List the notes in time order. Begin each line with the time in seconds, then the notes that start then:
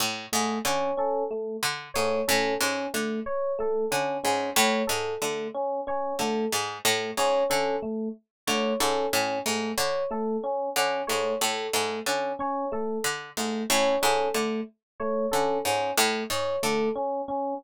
0.00 A2
0.32 G#2 A3
0.65 D3 C#4 C#5
0.97 C#4 A4
1.31 A3
1.63 D3
1.94 G#2 A3 C#5
2.28 A2 C#4 A4
2.60 G#2 C#4
2.94 D3 A3
3.26 C#5
3.59 A3 A4
3.91 D3 C#4
4.24 G#2 C#4
4.56 A2 A3 C#5
4.87 G#2 A4
5.22 D3 A3
5.54 C#4
5.87 C#4 C#5
6.19 D3 A3 A4
6.52 G#2
6.85 A2 A3
7.17 G#2 C#4 C#5
7.50 D3 C#4 A4
7.82 A3
8.47 D3 A3 C#5
8.80 G#2 C#4 A4
9.13 A2 C#4
9.46 G#2 A3
9.78 D3 C#5
10.11 A3 A4
10.43 C#4
10.76 D3 C#4
11.07 G#2 A3 C#5
11.41 A2 A4
11.73 G#2 A3
12.06 D3 C#4
12.39 C#4 C#5
12.72 A3 A4
13.04 D3
13.37 G#2 A3
13.70 A2 C#4 C#5
14.02 G#2 C#4 A4
14.34 D3 A3
15.00 A3 C#5
15.31 D3 C#4 A4
15.65 G#2 C#4
15.97 A2 A3
16.30 G#2 C#5
16.63 D3 A3 A4
16.96 C#4
17.28 C#4